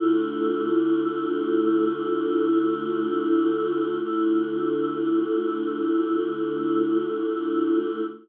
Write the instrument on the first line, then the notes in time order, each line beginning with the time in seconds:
choir aahs
0.00 D3 A3 E4 F4
4.03 D3 A3 E4 F4